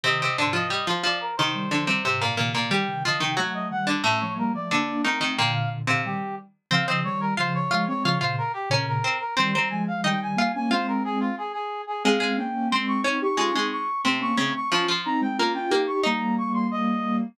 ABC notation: X:1
M:2/2
L:1/8
Q:1/2=90
K:Cm
V:1 name="Brass Section"
e2 c e e c d B | c4 z4 | g2 e g ^f e f d | =e ^c B d d2 B z |
g f z f G2 z2 | [K:Fm] f e d B c d2 d | d c B G B B2 B | c' b a f g a2 a |
c B A F A A2 A | f2 g2 c' d' d' d' | d'2 d'2 c' d' d' d' | d' c' b g b g2 d' |
b2 d' c' e3 z |]
V:2 name="Pizzicato Strings"
[C,C] [C,C] [D,D] [F,F] [G,G] [F,F] [F,F]2 | [E,E]2 [D,D] [C,C] [C,C] [B,,B,] [B,,B,] [B,,B,] | [G,G]2 [F,F] [E,E] [^F,^F]3 [D,D] | [=A,,=A,]4 [D,D]2 [E,E] [E,E] |
[B,,B,]3 [C,C]3 z2 | [K:Fm] [Cc] [Cc]2 z [Ff]2 [Ff] z | [Ff] [Ff]2 z [Dd]2 [Cc] z | [Cc] [Cc]2 z [Ee]2 [Ff] z |
[Ff]4 z4 | [A,A] [A,A]2 z [Cc]2 [Dd] z | [A,A] [A,A]2 z [C,C]2 [D,D] z | [F,F] [F,F]2 z [B,B]2 [B,B] z |
[Ee]6 z2 |]
V:3 name="Ocarina"
[C,E,]2 [A,,C,]2 z4 | [C,E,] [E,G,] [D,F,] [E,G,] [A,,C,]2 [C,E,]2 | [E,G,] [C,E,] [D,F,] [C,E,] [^F,=A,]2 [E,G,]2 | [=A,^C] [F,A,] [G,B,] [F,A,] [B,D]2 [A,=C]2 |
[B,,D,]3 [B,,D,] [E,G,]2 z2 | [K:Fm] [D,F,] [D,F,] [E,G,]2 [D,F,]2 [F,A,] [A,C] | [D,F,] [B,,D,] z2 [B,,D,]2 z2 | [E,G,] [E,G,] [F,A,]2 [E,G,]2 [G,B,] [B,D] |
[A,C]4 z4 | [A,C] [A,C] [B,D]2 [A,C]2 [CE] [EG] | [DF] [CE] z2 [=A,C] [B,D] [A,C] z | [DF] z [CE] [A,C] [DF] [DF] [EG]2 |
[G,B,]8 |]